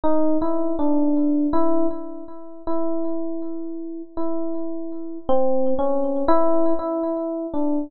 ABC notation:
X:1
M:7/8
L:1/8
Q:1/4=80
K:none
V:1 name="Electric Piano 1"
_E =E D2 E z2 | E4 E3 | (3C2 _D2 E2 E2 =D |]